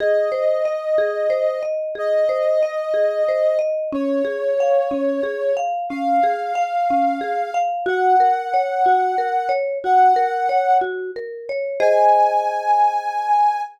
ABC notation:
X:1
M:6/8
L:1/8
Q:3/8=61
K:Abmix
V:1 name="Ocarina"
e6 | e6 | d6 | f6 |
g6 | g3 z3 | a6 |]
V:2 name="Marimba"
A c e A c e | A c e A c e | D A f D A f | D A f D A f |
G B d G B d | G B d G B d | [Ace]6 |]